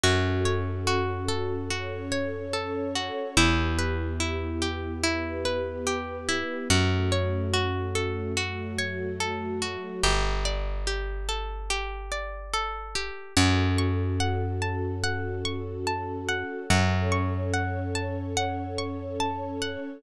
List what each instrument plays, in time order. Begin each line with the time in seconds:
0.03 electric bass (finger) F#2, string ensemble 1 C#4 F#4 A4, pizzicato strings F#4
0.45 pizzicato strings C#5
0.87 pizzicato strings F#4
1.28 pizzicato strings A4
1.70 string ensemble 1 C#4 A4 C#5, pizzicato strings F#4
2.12 pizzicato strings C#5
2.53 pizzicato strings A4
2.95 pizzicato strings F#4
3.36 electric bass (finger) E2, string ensemble 1 B3 E4 G4, pizzicato strings E4
3.78 pizzicato strings B4
4.20 pizzicato strings E4
4.62 pizzicato strings G4
5.03 string ensemble 1 B3 G4 B4, pizzicato strings E4
5.45 pizzicato strings B4
5.87 pizzicato strings G4
6.28 pizzicato strings E4
6.68 electric bass (finger) F#2, string ensemble 1 A3 C#4 F#4, pizzicato strings F#4
7.12 pizzicato strings C#5
7.53 pizzicato strings F#4
7.95 pizzicato strings A4
8.37 string ensemble 1 F#3 A3 F#4, pizzicato strings F#4
8.78 pizzicato strings C#5
9.20 pizzicato strings A4
9.62 pizzicato strings F#4
10.03 electric bass (finger) G1, pizzicato strings G4
10.45 pizzicato strings D5
10.87 pizzicato strings G4
11.29 pizzicato strings A4
11.70 pizzicato strings G4
12.12 pizzicato strings D5
12.53 pizzicato strings A4
12.95 pizzicato strings G4
13.36 electric bass (finger) F#2, string ensemble 1 C#4 F#4 A4, pizzicato strings F#5
13.78 pizzicato strings C#6
14.20 pizzicato strings F#5
14.62 pizzicato strings A5
15.03 pizzicato strings F#5
15.45 pizzicato strings C#6
15.87 pizzicato strings A5
16.28 pizzicato strings F#5
16.69 electric bass (finger) F#2, string ensemble 1 C#4 A4 C#5, pizzicato strings F#5
17.12 pizzicato strings C#6
17.53 pizzicato strings F#5
17.95 pizzicato strings A5
18.37 pizzicato strings F#5
18.78 pizzicato strings C#6
19.20 pizzicato strings A5
19.62 pizzicato strings F#5